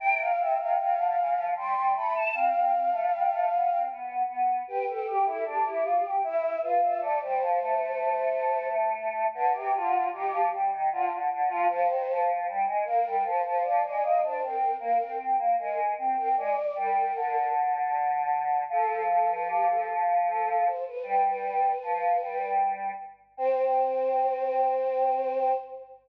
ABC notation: X:1
M:3/4
L:1/16
Q:1/4=77
K:C
V:1 name="Choir Aahs"
g f e f f4 c'2 b a | f8 z4 | B A G A G4 e2 B e | d c9 z2 |
[K:Cm] =B G F2 G2 z2 F z2 F | c3 z3 B2 c c d d | e c B2 B2 z2 B z2 B | d2 B4 z6 |
[K:C] A2 A B G A z2 A2 c B | B B7 z4 | c12 |]
V:2 name="Choir Aahs"
C,2 C, C, C, D, E, F, G, G, A,2 | C C C A, G, A, B, C B,2 B,2 | G G G E D E F G E2 F2 | A, G, F, A,9 |
[K:Cm] D, C, D,2 E, F, G, E, D, D, D, F, | F, E, F,2 G, A, B, G, F, F, F, A, | B, D C2 B, C2 B, A,2 C C | A, z G,2 D,8 |
[K:C] F,12 | G,4 F,2 G,4 z2 | C12 |]